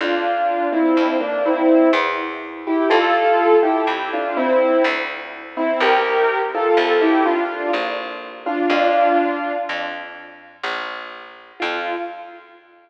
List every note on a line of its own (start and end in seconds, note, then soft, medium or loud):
0.01 0.88 F2 medium
0.01 0.68 D4 medium
0.01 0.68 F4 loud
0.72 1.14 C4 medium
0.72 1.14 E4 loud
0.97 1.84 F2 medium
1.20 1.43 A#3 medium
1.20 1.43 D4 loud
1.46 1.89 C4 medium
1.46 1.89 E4 loud
1.93 2.82 E2 loud
2.67 2.90 E4 medium
2.67 2.90 G4 loud
2.90 3.78 F2 loud
2.90 3.56 F4 loud
2.90 3.56 A4 loud
3.63 4.08 E4 medium
3.63 4.08 G4 loud
3.87 4.74 F2 medium
4.13 4.36 D4 medium
4.13 4.36 F4 loud
4.37 4.83 C4 loud
4.37 4.83 E4 loud
4.84 5.73 D2 loud
5.57 5.80 C4 loud
5.57 5.80 E4 loud
5.80 6.68 C2 loud
5.80 6.41 G4 loud
5.80 6.41 A#4 loud
6.55 7.01 F4 medium
6.55 7.01 A4 loud
6.77 7.64 C2 loud
7.01 7.24 E4 loud
7.01 7.24 G4 loud
7.25 7.71 D4 loud
7.25 7.71 F4 loud
7.73 8.63 A#1 loud
8.46 8.69 D4 medium
8.46 8.69 F4 loud
8.70 9.57 F2 loud
8.70 9.53 D4 loud
8.70 9.53 F4 loud
9.69 10.56 F2 medium
10.64 11.52 A#1 loud
11.60 11.96 F2 loud
11.60 11.94 F4 loud